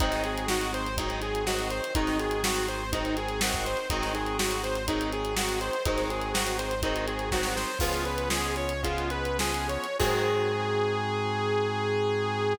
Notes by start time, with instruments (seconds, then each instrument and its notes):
0.00 synth bass 1 G#1, overdriven guitar D#3 F#3 G#3 C4, drawbar organ C4 D#4 F#4 G#4, lead 2 (sawtooth) D#4, kick, closed hi-hat
0.12 snare, closed hi-hat
0.24 lead 2 (sawtooth) G#4, closed hi-hat
0.38 closed hi-hat
0.48 overdriven guitar D#3 F#3 G#3 C4, lead 2 (sawtooth) F#4, snare
0.61 closed hi-hat
0.74 lead 2 (sawtooth) C5, closed hi-hat
0.86 closed hi-hat
0.97 overdriven guitar D#3 F#3 G#3 C4, drawbar organ C4 D#4 F#4 G#4, lead 2 (sawtooth) D#4, kick, closed hi-hat
1.10 closed hi-hat
1.22 lead 2 (sawtooth) G#4, closed hi-hat
1.35 closed hi-hat
1.46 overdriven guitar D#3 F#3 G#3 C4, lead 2 (sawtooth) F#4, snare
1.59 closed hi-hat
1.70 lead 2 (sawtooth) C5, closed hi-hat
1.84 closed hi-hat
1.95 synth bass 1 G#1, overdriven guitar D#3 F#3 G#3 C4, drawbar organ C4 D#4 F#4 G#4, lead 2 (sawtooth) D#4, kick, closed hi-hat
2.07 snare, closed hi-hat
2.19 lead 2 (sawtooth) G#4, closed hi-hat
2.31 closed hi-hat
2.44 overdriven guitar D#3 F#3 G#3 C4, lead 2 (sawtooth) F#4, snare
2.56 closed hi-hat
2.68 lead 2 (sawtooth) C5, closed hi-hat
2.92 overdriven guitar D#3 F#3 G#3 C4, drawbar organ C4 D#4 F#4 G#4, lead 2 (sawtooth) D#4, kick, closed hi-hat
3.05 closed hi-hat
3.17 lead 2 (sawtooth) G#4, closed hi-hat
3.28 closed hi-hat
3.41 overdriven guitar D#3 F#3 G#3 C4, lead 2 (sawtooth) F#4, snare
3.54 kick, closed hi-hat
3.65 lead 2 (sawtooth) C5, closed hi-hat
3.77 closed hi-hat
3.90 synth bass 1 G#1, overdriven guitar D#3 F#3 G#3 C4, drawbar organ C4 D#4 F#4 G#4, lead 2 (sawtooth) D#4, kick, closed hi-hat
4.02 snare, closed hi-hat
4.15 lead 2 (sawtooth) G#4, closed hi-hat
4.26 closed hi-hat
4.39 overdriven guitar D#3 F#3 G#3 C4, lead 2 (sawtooth) F#4, snare
4.51 closed hi-hat
4.63 lead 2 (sawtooth) C5, closed hi-hat
4.75 closed hi-hat
4.88 overdriven guitar D#3 F#3 G#3 C4, drawbar organ C4 D#4 F#4 G#4, lead 2 (sawtooth) D#4, kick, closed hi-hat
5.01 closed hi-hat
5.12 lead 2 (sawtooth) G#4, closed hi-hat
5.25 closed hi-hat
5.36 overdriven guitar D#3 F#3 G#3 C4, lead 2 (sawtooth) F#4, snare
5.49 closed hi-hat
5.61 lead 2 (sawtooth) C5, closed hi-hat
5.73 closed hi-hat
5.85 synth bass 1 G#1, overdriven guitar D#3 F#3 G#3 C4, drawbar organ C4 D#4 F#4 G#4, lead 2 (sawtooth) D#4, kick, closed hi-hat
5.97 snare, closed hi-hat
6.10 lead 2 (sawtooth) G#4, closed hi-hat
6.21 closed hi-hat
6.34 overdriven guitar D#3 F#3 G#3 C4, lead 2 (sawtooth) F#4, snare
6.47 closed hi-hat
6.59 lead 2 (sawtooth) C5, closed hi-hat
6.71 closed hi-hat
6.82 overdriven guitar D#3 F#3 G#3 C4, drawbar organ C4 D#4 F#4 G#4, lead 2 (sawtooth) D#4, kick, closed hi-hat
6.96 closed hi-hat
7.07 lead 2 (sawtooth) G#4, closed hi-hat
7.19 closed hi-hat
7.32 overdriven guitar D#3 F#3 G#3 C4, lead 2 (sawtooth) F#4, kick, snare
7.43 snare
7.56 lead 2 (sawtooth) C5, snare
7.79 synth bass 1 C#2, overdriven guitar F3 G#3 B3 C#4, drawbar organ B3 C#4 F4 G#4, lead 2 (sawtooth) F4, kick, crash
7.93 snare, closed hi-hat
8.05 lead 2 (sawtooth) B4, closed hi-hat
8.18 closed hi-hat
8.30 overdriven guitar F3 G#3 B3 C#4, lead 2 (sawtooth) G#4, snare
8.44 closed hi-hat
8.56 lead 2 (sawtooth) C#5, closed hi-hat
8.69 closed hi-hat
8.83 overdriven guitar F3 G#3 B3 C#4, drawbar organ B3 C#4 F4 G#4, lead 2 (sawtooth) F4, kick, closed hi-hat
8.98 closed hi-hat
9.10 lead 2 (sawtooth) B4, closed hi-hat
9.25 closed hi-hat
9.39 overdriven guitar F3 G#3 B3 C#4, lead 2 (sawtooth) G#4, snare
9.54 closed hi-hat
9.69 lead 2 (sawtooth) C#5, closed hi-hat
9.84 closed hi-hat
9.99 synth bass 1 G#2, overdriven guitar D#3 F#3 G#3 C4, drawbar organ C4 D#4 F#4 G#4, lead 2 (sawtooth) G#4, kick, crash